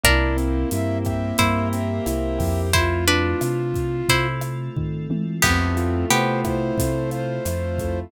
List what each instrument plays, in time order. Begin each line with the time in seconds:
0.04 synth bass 1 C2, acoustic grand piano A#3, pad 5 (bowed) A#3 C4 E4 G4, acoustic guitar (steel) D4 A#4, flute E4, kick, cross-stick, closed hi-hat
0.37 acoustic grand piano C4, closed hi-hat
0.71 synth bass 1 G2, acoustic grand piano E4, flute E5, closed hi-hat
1.05 acoustic grand piano G4, flute E5, kick, cross-stick, closed hi-hat
1.38 synth bass 1 G2, acoustic grand piano A#3, pad 5 (bowed) A#3 C4 G4 A#4, acoustic guitar (steel) E4 C5, kick, closed hi-hat
1.73 acoustic grand piano C4, flute E5, closed hi-hat
2.06 synth bass 1 C2, acoustic grand piano E4, cross-stick, closed hi-hat
2.39 synth bass 1 F2, acoustic grand piano G4, kick, open hi-hat
2.73 pad 5 (bowed) A3 C4 E4 F4, acoustic guitar (steel) E4 C5, flute F4, kick, closed hi-hat
3.08 acoustic guitar (steel) D4 B4, closed hi-hat
3.41 synth bass 1 C3, cross-stick, closed hi-hat
3.74 kick, closed hi-hat
4.09 synth bass 1 C3, pad 5 (bowed) A3 C4 F4 A4, acoustic guitar (steel) E4 C5, kick, closed hi-hat
4.41 cross-stick, closed hi-hat
4.76 synth bass 1 D#3, kick, floor tom
5.10 synth bass 1 E3, high tom
5.42 synth bass 1 F2, acoustic grand piano A3, pad 5 (bowed) A3 C4 E4 F4, acoustic guitar (steel) B3 G4, flute C4, kick, cross-stick, crash
5.77 acoustic grand piano F4, closed hi-hat
6.10 synth bass 1 C3, acoustic grand piano A3, acoustic guitar (steel) B3 G4, flute C5, closed hi-hat
6.45 acoustic grand piano E4, flute C5, kick, cross-stick, closed hi-hat
6.78 synth bass 1 C3, acoustic grand piano A3, kick, closed hi-hat
7.11 acoustic grand piano F4, flute C5, closed hi-hat
7.45 synth bass 1 F2, acoustic grand piano E4, cross-stick, closed hi-hat
7.78 acoustic grand piano A3, kick, closed hi-hat